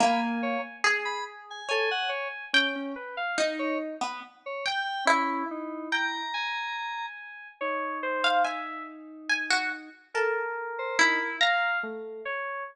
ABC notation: X:1
M:6/8
L:1/16
Q:3/8=47
K:none
V:1 name="Orchestral Harp"
^A,3 z ^G4 ^c4 | g4 ^D3 B, z2 g z | E2 z2 g8 | z3 f ^g4 g ^F z2 |
A4 E2 ^a2 z4 |]
V:2 name="Electric Piano 2"
b z ^c z2 b z ^g A ^f c z | z ^C z3 ^c z3 c g2 | ^C2 ^D2 ^a6 z2 | ^D12 |
z3 c ^D z7 |]
V:3 name="Electric Piano 2"
^g4 z4 g4 | ^C2 B f z8 | E6 ^g6 | ^c2 =c2 e2 z6 |
^A6 f2 =A,2 ^c2 |]